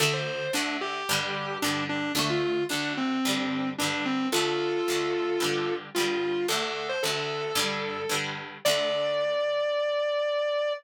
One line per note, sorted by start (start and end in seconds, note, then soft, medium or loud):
0.00 0.48 D2 medium
0.00 0.48 D3 medium
0.00 0.48 A3 medium
0.00 0.13 A4 medium
0.14 0.51 C5 medium
0.53 1.02 D2 medium
0.53 1.02 D3 medium
0.53 1.02 A3 medium
0.53 0.77 D4 medium
0.81 1.58 G4 medium
1.09 1.58 G2 medium
1.09 1.58 D3 medium
1.09 1.58 G3 medium
1.62 2.11 G2 medium
1.62 2.11 D3 medium
1.62 1.84 D4 medium
1.66 2.11 G3 medium
1.89 2.12 D4 medium
2.15 2.63 D2 medium
2.15 2.63 D3 medium
2.15 2.63 A3 loud
2.15 2.29 D4 medium
2.30 2.64 F4 medium
2.69 3.18 D2 medium
2.69 3.18 D3 medium
2.69 3.18 A3 medium
2.69 2.93 D4 medium
2.97 3.69 C4 medium
3.25 3.74 G2 medium
3.25 3.74 D3 medium
3.25 3.74 G3 medium
3.78 4.28 G2 medium
3.78 4.28 D3 medium
3.78 4.04 D4 medium
3.84 4.28 G3 medium
4.05 4.28 C4 medium
4.32 4.81 D2 medium
4.32 4.81 D3 medium
4.32 4.81 A3 medium
4.32 5.74 F4 medium
4.32 5.74 A4 medium
4.88 5.37 D2 medium
4.88 5.37 D3 medium
4.88 5.37 A3 medium
5.40 5.89 G2 medium
5.40 5.89 D3 medium
5.40 5.89 G3 medium
5.95 6.45 G2 medium
5.95 6.45 D3 medium
5.95 6.46 F4 medium
6.00 6.45 G3 medium
6.48 6.97 D2 medium
6.48 6.97 D3 medium
6.48 6.97 A3 medium
6.48 6.61 A4 medium
6.62 6.87 A4 medium
6.89 7.02 C5 medium
7.03 7.52 D2 medium
7.03 7.52 D3 medium
7.03 8.17 A4 medium
7.07 7.52 A3 medium
7.55 8.04 G2 medium
7.55 8.04 D3 medium
7.55 8.04 G3 medium
8.09 8.58 G2 medium
8.09 8.58 D3 medium
8.09 8.58 G3 medium
8.65 10.73 D2 medium
8.65 10.73 D3 loud
8.65 10.73 D5 loud
8.69 10.73 A3 loud